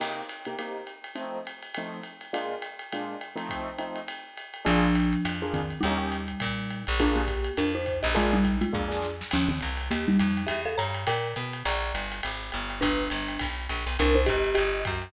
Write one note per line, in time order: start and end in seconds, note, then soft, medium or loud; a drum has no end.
0.00 0.22 C3 medium
0.00 0.22 A#3 medium
0.00 0.22 D#4 medium
0.00 0.22 G4 medium
0.00 crash medium
0.00 ride medium
0.28 hi-hat pedal medium
0.28 ride medium
0.45 0.55 C3 medium
0.45 0.55 A#3 medium
0.45 0.55 D#4 medium
0.45 0.55 G4 medium
0.45 ride medium
0.59 0.81 C3 medium
0.59 0.81 A#3 medium
0.59 0.81 D#4 medium
0.59 0.81 G4 medium
0.59 ride medium
0.86 hi-hat pedal medium
0.86 ride medium
1.04 ride medium
1.15 1.37 F3 medium
1.15 1.37 A3 medium
1.15 1.37 C4 medium
1.15 1.37 D#4 medium
1.15 ride medium
1.45 hi-hat pedal medium
1.45 ride medium
1.62 ride medium
1.74 1.99 F3 medium
1.74 1.99 A3 medium
1.74 1.99 C4 medium
1.74 1.99 D#4 medium
1.74 ride medium
2.03 hi-hat pedal medium
2.03 ride medium
2.21 ride medium
2.33 2.55 A#2 medium
2.33 2.55 G#3 medium
2.33 2.55 D4 medium
2.33 2.55 F4 medium
2.33 ride medium
2.62 hi-hat pedal medium
2.62 ride medium
2.79 ride medium
2.92 3.15 A#2 medium
2.92 3.15 G#3 medium
2.92 3.15 D4 medium
2.92 3.15 F4 medium
2.92 ride medium
3.21 hi-hat pedal medium
3.21 ride medium
3.36 3.70 F3 medium
3.36 3.70 A3 medium
3.36 3.70 C4 medium
3.36 3.70 D#4 medium
3.36 ride medium
3.49 kick soft
3.49 ride medium
3.78 4.00 F3 medium
3.78 4.00 A3 medium
3.78 4.00 C4 medium
3.78 4.00 D#4 medium
3.78 hi-hat pedal medium
3.78 ride medium
3.96 ride medium
4.08 ride medium
4.37 hi-hat pedal medium
4.37 ride medium
4.54 ride medium
4.65 5.15 A#1 loud
4.65 5.43 F3 medium
4.65 4.87 A#3 medium
4.65 4.87 D4 loud
4.65 5.43 D4 medium
4.65 4.87 F4 loud
4.65 4.87 G#4 loud
4.65 ride medium
4.94 hi-hat pedal medium
4.94 ride medium
5.13 ride medium
5.25 5.74 F2 medium
5.25 ride medium
5.42 5.61 A#3 medium
5.42 5.61 D4 medium
5.42 5.61 F4 medium
5.42 5.61 G#4 medium
5.53 5.79 D#3 medium
5.53 5.79 C4 medium
5.53 kick soft
5.53 hi-hat pedal medium
5.53 ride medium
5.70 ride soft
5.81 6.32 D#2 medium
5.81 6.83 G3 medium
5.81 6.83 D#4 medium
5.81 ride medium
5.85 5.97 A#3 loud
5.85 5.97 C#4 medium
5.85 5.97 D#4 medium
5.85 5.97 G4 loud
5.98 6.17 A#3 medium
5.98 6.17 C#4 medium
5.98 6.17 D#4 medium
5.98 6.17 G4 medium
6.11 hi-hat pedal medium
6.11 ride medium
6.28 ride medium
6.40 6.85 A#2 medium
6.40 kick soft
6.40 ride medium
6.69 hi-hat pedal medium
6.69 ride medium
6.87 7.49 A#1 medium
6.87 ride medium
6.99 7.21 A#3 medium
6.99 7.21 D4 medium
6.99 7.15 D4 medium
6.99 7.21 F4 medium
6.99 7.21 G#4 medium
6.99 7.15 A#4 medium
6.99 kick soft
6.99 ride medium
7.15 7.51 A#3 medium
7.15 7.51 G4 medium
7.27 kick soft
7.27 hi-hat pedal medium
7.27 ride medium
7.44 ride medium
7.57 8.02 F2 medium
7.57 7.72 D4 medium
7.57 7.72 A#4 medium
7.57 ride medium
7.75 8.00 D#4 medium
7.75 8.00 C5 medium
7.86 kick soft
7.86 hi-hat pedal medium
7.86 ride medium
8.03 8.64 A#1 medium
8.03 8.13 G4 soft
8.03 8.13 D#5 medium
8.03 ride medium
8.15 8.33 G#3 medium
8.15 8.37 A#3 loud
8.15 8.37 D4 loud
8.15 8.37 F4 medium
8.15 8.33 F4 medium
8.15 8.37 G#4 loud
8.15 ride medium
8.33 8.56 G3 medium
8.33 8.56 D#4 medium
8.44 kick soft
8.44 hi-hat pedal medium
8.44 ride medium
8.61 9.00 G#3 medium
8.61 9.00 F4 medium
8.61 ride medium
8.72 9.23 F2 medium
8.72 8.84 A#3 medium
8.72 8.84 D4 medium
8.72 8.84 F4 medium
8.72 8.84 G#4 medium
8.72 kick medium
8.88 9.07 A#3 medium
8.88 9.07 D4 medium
8.88 9.07 F4 medium
8.88 9.07 G#4 medium
8.88 snare medium
9.02 snare medium
9.21 snare medium
9.31 9.60 D#2 medium
9.31 9.50 F3 medium
9.31 9.50 C#4 medium
9.31 crash medium
9.31 ride medium
9.49 9.59 D#3 medium
9.49 9.59 C4 medium
9.61 9.89 C2 medium
9.61 hi-hat pedal medium
9.61 ride medium
9.77 ride medium
9.91 10.18 D#2 medium
9.91 10.06 A#3 medium
9.91 10.06 G4 medium
9.91 ride medium
10.08 10.43 G3 medium
10.08 10.43 D#4 medium
10.19 10.47 F2 medium
10.19 hi-hat pedal medium
10.19 ride medium
10.37 ride medium
10.47 10.76 E2 medium
10.47 10.62 G4 medium
10.47 10.62 E5 medium
10.47 ride medium
10.65 10.75 A4 medium
10.65 10.75 F5 medium
10.77 11.05 G2 medium
10.77 11.04 C#5 medium
10.77 11.04 A#5 medium
10.77 hi-hat pedal medium
10.77 ride medium
10.94 ride medium
11.07 11.34 A#2 medium
11.07 11.35 A#4 medium
11.07 11.35 G5 medium
11.07 ride medium
11.35 11.63 B2 medium
11.35 hi-hat pedal medium
11.35 ride medium
11.53 ride medium
11.65 11.92 A#1 medium
11.65 12.06 D5 medium
11.65 12.06 A#5 medium
11.65 ride medium
11.94 12.21 G1 medium
11.94 hi-hat pedal medium
11.94 ride medium
12.12 ride medium
12.23 12.51 G#1 medium
12.23 ride medium
12.52 12.80 G1 medium
12.52 hi-hat pedal medium
12.52 ride medium
12.70 ride medium
12.81 13.09 G1 medium
12.81 13.46 D4 medium
12.81 13.46 B4 medium
12.81 kick soft
12.81 ride medium
13.10 13.38 G1 medium
13.10 hi-hat pedal medium
13.10 ride medium
13.28 ride medium
13.39 13.68 B1 medium
13.39 kick soft
13.39 ride medium
13.69 13.85 A#1 medium
13.69 hi-hat pedal medium
13.69 ride medium
13.86 13.97 B1 medium
13.86 ride medium
13.99 14.26 C2 loud
13.99 14.16 D4 medium
13.99 14.16 A#4 medium
13.99 ride medium
14.15 14.27 D#4 medium
14.15 14.27 C5 medium
14.26 14.55 G1 medium
14.26 14.54 G4 medium
14.26 14.54 D#5 medium
14.26 kick medium
14.26 hi-hat pedal medium
14.26 ride medium
14.44 ride medium
14.55 14.84 G1 medium
14.55 14.81 G4 medium
14.55 14.81 D#5 medium
14.55 ride medium
14.85 15.12 F#2 medium
14.85 kick medium
14.85 hi-hat pedal medium
14.85 ride medium
15.02 ride medium